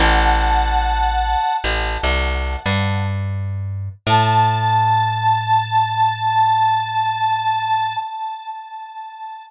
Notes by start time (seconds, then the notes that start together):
0.00 A1 F#5 A5
1.64 A1
2.03 C2
2.66 G2
4.06 A2 A5